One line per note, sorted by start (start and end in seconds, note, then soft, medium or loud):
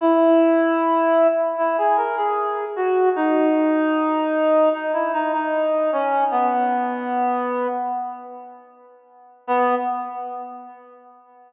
0.01 1.27 E4 medium
1.58 1.77 E4 medium
1.78 1.97 G#4 medium
1.97 2.15 A#4 medium
2.17 2.65 G#4 medium
2.76 3.09 F#4 medium
3.16 4.69 D#4 medium
4.73 4.92 D#4 medium
4.93 5.12 E4 medium
5.13 5.32 D#4 medium
5.33 5.90 D#4 medium
5.92 6.24 C#4 medium
6.31 7.67 B3 medium
9.47 9.75 B3 loud